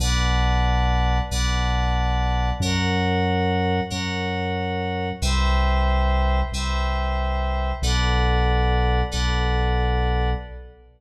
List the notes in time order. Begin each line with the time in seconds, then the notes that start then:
0.00 B1 B4 D5 F#5 A5
1.31 B1 B4 D5 F#5 A5
2.60 F#2 A#4 C#5 F#5
3.90 F#2 A#4 C#5 F#5
5.22 C2 B4 C5 E5 G5
6.52 C2 B4 C5 E5 G5
7.82 B1 A4 B4 D5 F#5
9.12 B1 A4 B4 D5 F#5